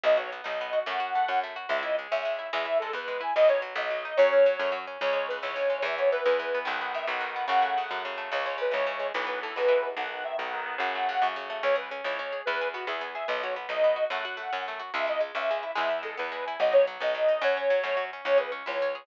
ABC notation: X:1
M:6/8
L:1/8
Q:3/8=145
K:C#m
V:1 name="Accordion"
d c z d3 | f4 z2 | e d z e3 | e2 A B2 g |
d c z d3 | c5 z | c c B c3 | e c B B3 |
f f e f3 | f4 z2 | c c B c3 | B B A B3 |
f f e f3 | f4 z2 | c B z c3 | B2 F G2 e |
d c z d3 | f4 z2 | e d z e3 | e2 A B2 g |
d c z d3 | c5 z | c B z c3 |]
V:2 name="Acoustic Guitar (steel)"
B, F B, D B, F | A, F A, C A, F | G, E G, C G, E | G, E G, B, G, E |
F, D F, B, F, D | F, C F, A, F, C | C, G, C, E, C, G, | E, B, E, G, E, B, |
D, B, D, F, D, B, | C, A, C, F, C, A, | C, G, C, E, C, G, | E, B, E, G, E, B, |
D, B, D, F, D, B, | C, A, C, F, C, A, | C G C E C G | B, G B, E B, G |
B, F B, D B, F | A, F A, C A, F | G, E G, C G, E | G, E G, B, G, E |
F, D F, B, F, D | F, C F, A, F, C | C G C E C G |]
V:3 name="Electric Bass (finger)" clef=bass
B,,,3 B,,,3 | F,,3 F,,3 | C,,3 C,,3 | E,,3 E,,3 |
B,,,3 B,,,3 | F,,3 F,,3 | C,,3 C,,3 | E,,3 E,,3 |
B,,,3 B,,,3 | F,,3 F,,3 | C,,3 C,,3 | B,,,3 B,,,3 |
B,,,3 B,,,3 | F,,3 F,,3 | C,,3 C,,3 | E,,3 E,,3 |
B,,,3 B,,,3 | F,,3 F,,3 | C,,3 C,,3 | E,,3 E,,3 |
B,,,3 B,,,3 | F,,3 F,,3 | C,,3 C,,3 |]